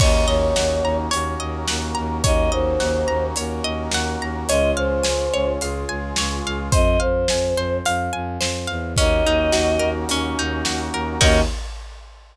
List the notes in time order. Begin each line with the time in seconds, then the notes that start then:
0.00 D#2 A#3 C#4 D#4 F#4 C#5 D#5, kick, crash
0.27 D#2 C#5 D#5
0.56 D#2 F#5, snare
0.83 D#2 A#5
1.11 D#2 A#3 C#4 F#4 A#4 C#5, closed hi-hat
1.40 D#2 D#5
1.68 D#2 F#5, snare
1.95 D#2 A#5
2.24 D#2 A#3 C#4 D#4 F#4 C#5 D#5, kick, closed hi-hat
2.52 D#2 C5 D#5
2.80 D#2 F#5, snare
3.08 D#2 A#5
3.36 D#2 A#3 C#4 F#4 A#4 C#5, closed hi-hat
3.64 D#2 D#5
3.91 D#2 F#5, snare
4.20 D#2 A#5
4.48 C#2 G#3 C#4 F4 C#5 D#5, closed hi-hat
4.77 C#2 C5 F5
5.03 C#2 G#5, snare
5.33 C#2 C#5
5.60 C#2 G#3 F4 G#4 F5, closed hi-hat
5.89 C#2 G#5
6.16 C#2 C#5, snare
6.45 C#2 F5
6.72 F2 C5 D#5, kick, closed hi-hat
7.00 F2 C5 F5
7.28 F2 G#5, snare
7.56 F2 C5
7.85 F2 F5, closed hi-hat
8.13 F2 G#5
8.41 F2 C5, snare
8.67 E2 F5
8.96 D#2 A#3 C#4 D#4 F#4 D#5, kick, closed hi-hat
9.25 D#2 D#4
9.52 D#2 F#4, snare
9.79 D#2 A#4
10.09 D#2 C#4, closed hi-hat
10.38 D#2 D#4
10.65 D#2 F#4, snare
10.93 D#2 A#4
11.21 D#2 A#3 C#4 D#4 F#4 A#4 D#5, kick, crash